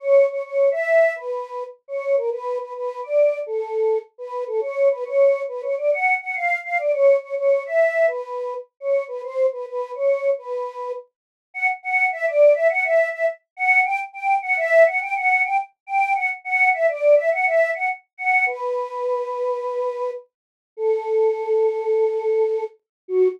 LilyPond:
\new Staff { \time 4/4 \key fis \minor \tempo 4 = 104 cis''8 cis''16 cis''8 e''8. b'4 r16 cis''8 ais'16 | b'8 b'16 b'8 d''8. a'4 r16 b'8 a'16 | cis''8 b'16 cis''8. b'16 cis''16 d''16 fis''8 fis''16 eis''8 eis''16 d''16 | cis''8 cis''16 cis''8 e''8. b'4 r16 cis''8 b'16 |
bis'8 b'16 b'8 cis''8. b'4 r4 | \key b \minor fis''16 r16 fis''8 e''16 d''8 e''16 fis''16 e''8 e''16 r8 fis''8 | g''16 r16 g''8 fis''16 e''8 fis''16 g''16 fis''8 g''16 r8 g''8 | fis''16 r16 fis''8 e''16 d''8 e''16 fis''16 e''8 fis''16 r8 fis''8 |
b'2. r4 | \key fis \minor a'2.~ a'8 r8 | fis'4 r2. | }